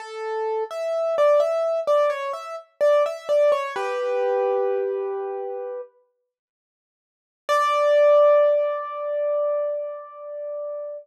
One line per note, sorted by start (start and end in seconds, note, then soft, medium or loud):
0.00 0.64 A4 medium
0.71 1.16 E5 medium
1.18 1.40 D5 medium
1.40 1.80 E5 medium
1.87 2.10 D5 medium
2.10 2.32 C#5 medium
2.33 2.56 E5 medium
2.81 3.03 D5 medium
3.06 3.28 E5 medium
3.29 3.51 D5 medium
3.52 3.74 C#5 medium
3.76 5.81 G4 medium
3.76 5.81 B4 medium
7.49 10.97 D5 loud